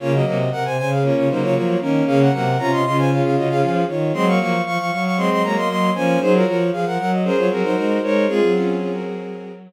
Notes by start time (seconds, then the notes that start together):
0.00 C#3 A#3 C#4 F4 C#5
0.13 F#3 A#3 F#4 D#5
0.25 C3 F#3 A#3 F#4 D#5
0.52 C3 A#4 F#5
0.65 C3 C5 G#5
0.78 C#3 C5 G#5
0.91 G#4 F5
1.02 A#3 C#4 F4 C#5
1.16 C#3 F4 C#5
1.29 C#3 F#3 A#3 D#4 C5
1.42 C#3 F4 C#5
1.55 F3 F4 C#5
1.81 D#3 A#3 C#4 A#4
2.06 C#3 A#3 C#4 G#4 F5
2.20 A#4 F#5
2.32 C3 F#3 A#3 A#4 F#5
2.59 C3 C#4 F4 C#5 A#5
2.72 C3 D#5 C6
2.84 C#3 C#4 F4 D#5 C6
2.97 C5 G#5
3.10 C#4 F4 G#4 F5
3.23 C#3 G#4 F5
3.36 C#3 F#4 D#5
3.49 C#3 G#4 F5
3.62 F3 G#4 F5
3.88 D#3 F4 C#5
4.13 F#3 G#3 C4 D#5 C6
4.27 F#3 A#3 F5 C#6
4.40 F3 F#3 A#3 F5 C#6
4.65 F3 F5 C#6
4.78 F3 F5 C#6
4.91 F#3 F5 C#6
5.04 F5 C#6
5.17 G#3 C4 D#5 C6
5.30 F#3 D#5 C6
5.43 F#3 G#3 A#3 C#5 A#5
5.56 A#3 D#5 C6
5.69 F#3 D#5 C6
5.95 F3 A#3 C#4 C5 G#5
6.20 F#3 D#4 G#4 C5
6.33 F4 F#4 A#4 C#5
6.45 F3 F4 F#4 A#4 C#5
6.72 F3 G#4 F5
6.85 F3 A#4 F#5
6.98 F#3 A#4 F#5
7.11 F#4 D#5
7.24 C#4 G#4 A#4 C5
7.37 F#3 F4 C#5
7.50 F#3 C4 F#4 G#4 A#4
7.63 F#3 D#4 C5
7.76 G#3 D#4 C5
8.02 G#3 D#4 A#4 C5 C#5
8.28 G#3 C4 F4 G#4
8.41 F#3
8.55 C#4 F4
8.79 C#4 F4
8.92 F#4 A#4